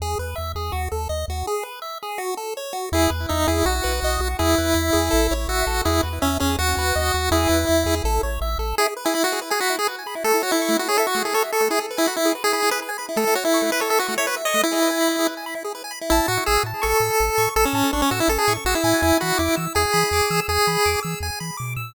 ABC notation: X:1
M:4/4
L:1/16
Q:1/4=164
K:E
V:1 name="Lead 1 (square)"
z16 | z16 | E2 z2 D2 E2 F8 | E12 F4 |
E2 z2 C2 C2 F8 | E8 z8 | G z2 E E F2 z G F2 G z4 | A2 F E3 F G A F2 G A z A2 |
G z2 E F E2 z G G2 B z4 | A2 F E3 B A A F2 c B z d2 | E8 z8 | [K:A] E2 F2 G2 z2 A8 |
A C3 D C F E A G2 z F E3 | E2 F2 E2 z2 G8 | G6 z10 |]
V:2 name="Lead 1 (square)"
G2 B2 e2 G2 F2 A2 d2 F2 | G2 B2 e2 G2 F2 A2 c2 F2 | G2 B2 e2 G2 F2 B2 d2 F2 | G2 B2 e2 G2 A2 c2 e2 A2 |
G2 B2 e2 G2 F2 B2 d2 F2 | G2 B2 e2 G2 A2 c2 e2 A2 | E G B g b E G B g b E G B g b E | A, E c e c' A, E c e c' A, E c e c' A, |
E G B g b E G B g b E G B g b E | A, E c e c' A, E c e c' A, E c e c' A, | E G B g b E G B g b E G B g b E | [K:A] a2 c'2 e'2 a2 c'2 e'2 a2 c'2 |
e'2 a2 c'2 e'2 a2 c'2 e'2 g2- | g2 b2 d'2 e'2 g2 b2 d'2 e'2 | g2 b2 d'2 e'2 g2 b2 d'2 e'2 |]
V:3 name="Synth Bass 1" clef=bass
E,,2 E,,2 E,,2 E,,2 D,,2 D,,2 D,,2 D,,2 | z16 | E,,2 E,,2 E,,2 E,,2 B,,,2 B,,,2 B,,,2 B,,,2 | E,,2 E,,2 E,,2 E,,2 A,,,2 A,,,2 A,,,2 A,,,2 |
E,,2 E,,2 E,,2 E,,2 D,,2 D,,2 D,,2 D,,2 | E,,2 E,,2 E,,2 E,,2 A,,,2 A,,,2 A,,,2 A,,,2 | z16 | z16 |
z16 | z16 | z16 | [K:A] A,,,2 A,,2 A,,,2 A,,2 A,,,2 A,,2 A,,,2 A,,2 |
A,,,2 A,,2 A,,,2 A,,2 A,,,2 A,,2 A,,,2 A,,2 | E,,2 E,2 E,,2 E,2 E,,2 E,2 E,,2 E,2 | E,,2 E,2 E,,2 E,2 E,,2 E,2 B,,2 ^A,,2 |]